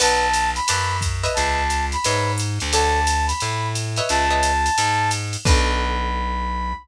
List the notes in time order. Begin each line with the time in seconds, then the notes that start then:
0.00 B1 B4 D5 F#5 A5, crash, ride
0.33 hi-hat pedal, ride
0.56 B5, ride
0.68 F#2 B4 D5 F#5 A5, ride
1.01 kick, hi-hat pedal, ride
1.23 B4 C#5 D#5 E5, ride
1.34 C#2 A5, ride
1.70 hi-hat pedal, ride
1.92 B5, ride
2.04 G#2 B4 C#5 D#5 E5, ride
2.38 hi-hat pedal, ride
2.60 D2, ride
2.72 A4 C#5 D5 F#5 A5, ride
3.07 hi-hat pedal, ride
3.27 B5, ride
3.40 A2, ride
3.75 hi-hat pedal, ride
3.96 B4 C#5 D#5 E5, ride
4.09 C#2 A5, ride
4.30 B4 C#5 D#5 E5
4.43 hi-hat pedal, ride
4.66 ride
4.78 G#2, ride
5.11 hi-hat pedal, ride
5.33 ride
5.45 B1 B3 D4 F#4 A4 B5, kick, crash